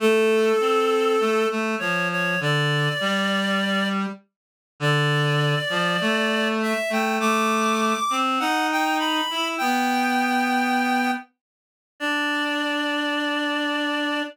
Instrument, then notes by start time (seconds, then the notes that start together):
clarinet
0.00 A3 A4
0.60 C4
1.20 A3
1.50 A3
1.79 F3 C#5
2.12 C#5
2.40 D3 D5
3.00 G3
4.80 D3 D5
5.70 F3
6.01 A3
6.62 E5
6.90 A3 G5
7.20 A3 D6
8.10 C4
8.39 D#4 F#5
8.72 G5
8.99 B5
9.30 E4
9.58 B3 G5
12.00 D4 D5